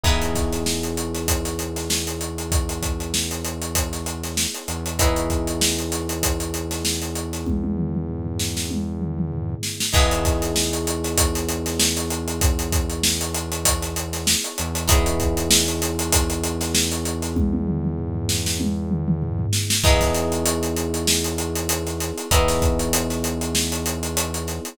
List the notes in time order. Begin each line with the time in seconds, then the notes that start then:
0.04 E2 B3 D#4 E4 G#4 B4, kick, crash
0.22 closed hi-hat
0.35 kick, snare, closed hi-hat
0.52 snare, closed hi-hat
0.66 snare
0.83 closed hi-hat
0.97 closed hi-hat
1.14 snare, closed hi-hat
1.28 kick, closed hi-hat
1.45 snare, closed hi-hat
1.59 closed hi-hat
1.76 snare, closed hi-hat
1.90 snare, closed hi-hat
2.07 closed hi-hat
2.21 closed hi-hat
2.38 closed hi-hat
2.52 kick, closed hi-hat
2.69 closed hi-hat
2.83 kick, closed hi-hat
3.00 closed hi-hat
3.14 snare
3.31 closed hi-hat
3.45 closed hi-hat
3.62 closed hi-hat
3.75 kick, closed hi-hat
3.93 snare, closed hi-hat
4.06 closed hi-hat
4.24 snare, closed hi-hat
4.37 snare
4.54 closed hi-hat
4.68 E2, closed hi-hat
4.86 closed hi-hat
4.99 B3 D#4 E4 G#4 B4, kick, closed hi-hat
5.16 closed hi-hat
5.30 kick, closed hi-hat
5.47 closed hi-hat
5.61 snare
5.78 closed hi-hat
5.92 snare, closed hi-hat
6.09 closed hi-hat
6.23 kick, closed hi-hat
6.40 closed hi-hat
6.54 closed hi-hat
6.71 snare, closed hi-hat
6.85 snare
7.02 closed hi-hat
7.15 closed hi-hat
7.33 snare, closed hi-hat
7.46 kick, high tom
7.64 high tom
7.77 mid tom
7.95 mid tom
8.09 floor tom
8.26 floor tom
8.40 snare
8.57 snare
8.70 high tom
9.01 mid tom
9.18 mid tom
9.32 floor tom
9.49 floor tom
9.63 snare
9.80 snare
9.93 E2 B3 D#4 E4 G#4 B4, kick, crash
10.11 closed hi-hat
10.25 kick, snare, closed hi-hat
10.42 snare, closed hi-hat
10.56 snare
10.73 closed hi-hat
10.87 closed hi-hat
11.04 snare, closed hi-hat
11.18 kick, closed hi-hat
11.35 snare, closed hi-hat
11.49 closed hi-hat
11.66 snare, closed hi-hat
11.80 snare, closed hi-hat
11.97 closed hi-hat
12.10 closed hi-hat
12.28 closed hi-hat
12.41 kick, closed hi-hat
12.59 closed hi-hat
12.72 kick, closed hi-hat
12.90 closed hi-hat
13.03 snare
13.21 closed hi-hat
13.35 closed hi-hat
13.52 closed hi-hat
13.65 kick, closed hi-hat
13.82 snare, closed hi-hat
13.96 closed hi-hat
14.13 snare, closed hi-hat
14.27 snare
14.44 closed hi-hat
14.58 E2, closed hi-hat
14.75 closed hi-hat
14.88 B3 D#4 E4 G#4 B4, kick, closed hi-hat
15.06 closed hi-hat
15.20 kick, closed hi-hat
15.37 closed hi-hat
15.51 snare
15.68 closed hi-hat
15.82 snare, closed hi-hat
15.99 closed hi-hat
16.13 kick, closed hi-hat
16.30 closed hi-hat
16.44 closed hi-hat
16.61 snare, closed hi-hat
16.75 snare
16.92 closed hi-hat
17.05 closed hi-hat
17.22 snare, closed hi-hat
17.36 kick, high tom
17.53 high tom
17.67 mid tom
17.84 mid tom
17.98 floor tom
18.15 floor tom
18.29 snare
18.46 snare
18.60 high tom
18.91 mid tom
19.08 mid tom
19.22 floor tom
19.39 floor tom
19.53 snare
19.70 snare
19.84 E2 B3 D#4 E4 G#4 B4, kick, crash
20.01 kick, snare, closed hi-hat
20.15 snare, closed hi-hat
20.32 closed hi-hat
20.46 closed hi-hat
20.63 closed hi-hat
20.77 closed hi-hat
20.94 closed hi-hat
21.07 snare
21.24 closed hi-hat
21.38 closed hi-hat
21.56 closed hi-hat
21.69 closed hi-hat
21.86 snare, closed hi-hat
22.00 snare, closed hi-hat
22.18 closed hi-hat
22.31 E2 B3 D#4 E4 G#4 B4, kick, closed hi-hat
22.48 snare, closed hi-hat
22.62 kick, closed hi-hat
22.79 closed hi-hat
22.93 closed hi-hat
23.10 snare, closed hi-hat
23.24 closed hi-hat
23.41 closed hi-hat
23.55 snare
23.72 closed hi-hat
23.86 closed hi-hat
24.03 closed hi-hat
24.17 closed hi-hat
24.34 closed hi-hat
24.47 snare, closed hi-hat
24.65 closed hi-hat